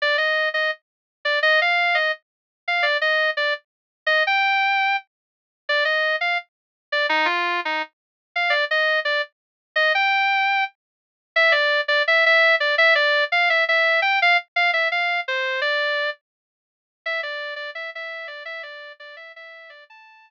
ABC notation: X:1
M:4/4
L:1/8
Q:1/4=169
K:Gm
V:1 name="Distortion Guitar"
d e2 e z3 d | e f2 e z3 f | d e2 d z3 e | g4 z4 |
d e2 f z3 d | E F2 E z3 f | d e2 d z3 e | g4 z4 |
[K:Am] e d2 d e e2 d | e d2 f e e2 g | f z f e f2 c2 | d3 z5 |
e d2 d e e2 d | e d2 d e e2 d | a3 z5 |]